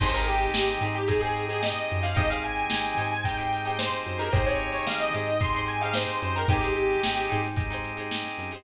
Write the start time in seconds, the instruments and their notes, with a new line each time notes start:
0.00 synth bass 1 G#1, drawbar organ C4 D#4 G4 G#4, acoustic guitar (steel) D#4 G4 G#4 C5, lead 2 (sawtooth) C5, kick, crash
0.13 acoustic guitar (steel) D#4 G4 G#4, lead 2 (sawtooth) A#4, closed hi-hat
0.17 acoustic guitar (steel) C5
0.26 lead 2 (sawtooth) G4, snare, closed hi-hat
0.41 closed hi-hat
0.54 synth bass 1 G#1, snare
0.68 snare, closed hi-hat
0.81 synth bass 1 G#2, acoustic guitar (steel) D#4 G4 G#4, closed hi-hat
0.86 acoustic guitar (steel) C5
0.95 lead 2 (sawtooth) G4, closed hi-hat
1.08 drawbar organ C4 D#4 G4 G#4, lead 2 (sawtooth) G#4, kick, closed hi-hat
1.21 acoustic guitar (steel) D#4 G4 G#4 C5, lead 2 (sawtooth) G#4, closed hi-hat
1.36 closed hi-hat
1.49 acoustic guitar (steel) D#4 G4 G#4, lead 2 (sawtooth) G#4, closed hi-hat
1.53 acoustic guitar (steel) C5
1.62 lead 2 (sawtooth) D#5, snare
1.76 closed hi-hat
1.90 synth bass 1 F#2, closed hi-hat
2.03 acoustic guitar (steel) D#4 G4 G#4 C5, lead 2 (sawtooth) F5, closed hi-hat
2.15 synth bass 1 G#1, drawbar organ C4 D#4 G4 G#4, acoustic guitar (steel) D#4 G4 G#4 C5, lead 2 (sawtooth) D#5, kick, closed hi-hat
2.29 acoustic guitar (steel) D#4 G4 G#4 C5, lead 2 (sawtooth) F5, closed hi-hat
2.42 lead 2 (sawtooth) G#5, closed hi-hat
2.56 closed hi-hat
2.70 synth bass 1 G#1, snare
2.84 closed hi-hat
2.97 synth bass 1 G#2, acoustic guitar (steel) D#4 G4 G#4, snare, closed hi-hat
3.01 acoustic guitar (steel) C5
3.11 lead 2 (sawtooth) G#5, closed hi-hat
3.24 drawbar organ C4 D#4 G4 G#4, lead 2 (sawtooth) G5, kick, closed hi-hat
3.37 acoustic guitar (steel) D#4 G4 G#4 C5, lead 2 (sawtooth) G5, closed hi-hat
3.53 closed hi-hat
3.65 acoustic guitar (steel) D#4 G4 G#4, lead 2 (sawtooth) G5, closed hi-hat
3.69 acoustic guitar (steel) C5
3.78 lead 2 (sawtooth) C5, snare
3.92 snare, closed hi-hat
4.06 synth bass 1 F#2, closed hi-hat
4.19 acoustic guitar (steel) D#4 G4 G#4 C5, lead 2 (sawtooth) A#4, closed hi-hat
4.32 synth bass 1 G#1, drawbar organ C4 D#4 G4 G#4, acoustic guitar (steel) D#4 G4 G#4 C5, lead 2 (sawtooth) C5, kick, closed hi-hat
4.46 acoustic guitar (steel) D#4 G4 G#4, lead 2 (sawtooth) C#5, closed hi-hat
4.50 acoustic guitar (steel) C5
4.59 closed hi-hat
4.72 lead 2 (sawtooth) C#5, snare, closed hi-hat
4.87 synth bass 1 G#1, lead 2 (sawtooth) F5, snare
5.00 lead 2 (sawtooth) D#5, closed hi-hat
5.13 synth bass 1 G#2, acoustic guitar (steel) D#4 G4 G#4 C5, lead 2 (sawtooth) D#5, closed hi-hat
5.26 closed hi-hat
5.41 drawbar organ C4 D#4 G4 G#4, lead 2 (sawtooth) C6, kick, closed hi-hat
5.53 acoustic guitar (steel) D#4 G4 G#4, closed hi-hat
5.58 acoustic guitar (steel) C5
5.67 lead 2 (sawtooth) G#5, closed hi-hat
5.81 acoustic guitar (steel) D#4 G4 G#4, lead 2 (sawtooth) F5, closed hi-hat
5.85 acoustic guitar (steel) C5
5.93 lead 2 (sawtooth) C5, snare
6.08 closed hi-hat
6.22 synth bass 1 F#2, lead 2 (sawtooth) C5, closed hi-hat
6.35 acoustic guitar (steel) D#4 G4 G#4, lead 2 (sawtooth) A#4, closed hi-hat
6.39 acoustic guitar (steel) C5
6.48 synth bass 1 G#1, drawbar organ C4 D#4 G4 G#4, acoustic guitar (steel) D#4 G4 G#4 C5, lead 2 (sawtooth) G4, kick, closed hi-hat
6.61 acoustic guitar (steel) D#4 G4 G#4, closed hi-hat
6.65 acoustic guitar (steel) C5
6.76 lead 2 (sawtooth) G4, closed hi-hat
6.91 closed hi-hat
7.03 synth bass 1 G#1, snare
7.16 closed hi-hat
7.29 synth bass 1 G#2, acoustic guitar (steel) D#4 G4 G#4 C5, closed hi-hat
7.43 snare, closed hi-hat
7.56 drawbar organ C4 D#4 G4 G#4, kick, closed hi-hat
7.70 acoustic guitar (steel) D#4 G4 G#4 C5, closed hi-hat
7.84 closed hi-hat
7.97 acoustic guitar (steel) D#4 G4 G#4 C5, closed hi-hat
8.11 snare
8.24 closed hi-hat
8.38 synth bass 1 F#2, closed hi-hat
8.51 acoustic guitar (steel) D#4 G4 G#4, closed hi-hat
8.56 acoustic guitar (steel) C5